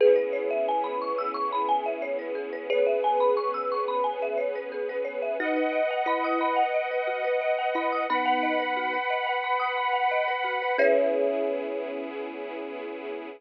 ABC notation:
X:1
M:4/4
L:1/16
Q:1/4=89
K:C#dor
V:1 name="Kalimba"
[GB]16 | [GB]16 | D3 z E4 z6 E2 | [B,D]6 z10 |
C16 |]
V:2 name="Marimba"
G B c e g b c' e' c' b g e c B G B | c e g b c' e' c' b g e c B G B c e | F B d f b d' b f d B F B d f b d' | b f d B F B d f b d' b f d B F B |
[GBce]16 |]
V:3 name="String Ensemble 1"
[B,CEG]16 | [B,CGB]16 | [Bdf]16 | [Bfb]16 |
[B,CEG]16 |]
V:4 name="Synth Bass 2" clef=bass
C,,16- | C,,16 | B,,,16- | B,,,16 |
C,,16 |]